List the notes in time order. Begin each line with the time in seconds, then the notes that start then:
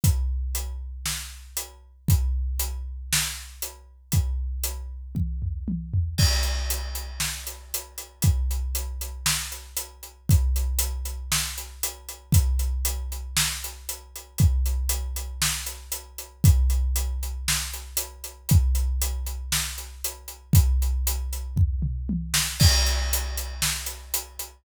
0.04 kick, closed hi-hat
0.55 closed hi-hat
1.06 snare
1.57 closed hi-hat
2.08 kick, closed hi-hat
2.60 closed hi-hat
3.13 snare
3.62 closed hi-hat
4.12 kick, closed hi-hat
4.64 closed hi-hat
5.15 kick, high tom
5.42 floor tom
5.68 high tom
5.94 floor tom
6.18 kick, crash
6.43 closed hi-hat
6.70 closed hi-hat
6.95 closed hi-hat
7.20 snare
7.47 closed hi-hat
7.74 closed hi-hat
7.98 closed hi-hat
8.22 kick, closed hi-hat
8.51 closed hi-hat
8.75 closed hi-hat
9.01 closed hi-hat
9.26 snare
9.52 closed hi-hat
9.77 closed hi-hat
10.03 closed hi-hat
10.29 kick, closed hi-hat
10.56 closed hi-hat
10.79 closed hi-hat
11.05 closed hi-hat
11.32 snare
11.58 closed hi-hat
11.83 closed hi-hat
12.09 closed hi-hat
12.32 kick, closed hi-hat
12.59 closed hi-hat
12.85 closed hi-hat
13.12 closed hi-hat
13.37 snare
13.64 closed hi-hat
13.89 closed hi-hat
14.16 closed hi-hat
14.38 kick, closed hi-hat
14.66 closed hi-hat
14.89 closed hi-hat
15.16 closed hi-hat
15.42 snare
15.66 closed hi-hat
15.92 closed hi-hat
16.18 closed hi-hat
16.44 kick, closed hi-hat
16.70 closed hi-hat
16.96 closed hi-hat
17.23 closed hi-hat
17.48 snare
17.73 closed hi-hat
17.97 closed hi-hat
18.24 closed hi-hat
18.49 kick, closed hi-hat
18.75 closed hi-hat
19.02 closed hi-hat
19.26 closed hi-hat
19.52 snare
19.78 closed hi-hat
20.04 closed hi-hat
20.28 closed hi-hat
20.53 kick, closed hi-hat
20.82 closed hi-hat
21.07 closed hi-hat
21.33 closed hi-hat
21.56 kick, floor tom
21.82 mid tom
22.09 high tom
22.34 snare
22.60 kick, crash
22.86 closed hi-hat
23.13 closed hi-hat
23.37 closed hi-hat
23.62 snare
23.86 closed hi-hat
24.14 closed hi-hat
24.39 closed hi-hat